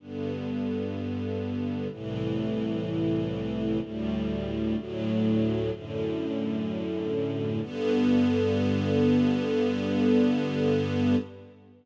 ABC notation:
X:1
M:4/4
L:1/8
Q:1/4=63
K:G
V:1 name="String Ensemble 1"
[G,,D,B,]4 [C,,A,,E,]4 | [D,,A,,G,]2 [D,,A,,F,]2 [F,,A,,D,]4 | [G,,D,B,]8 |]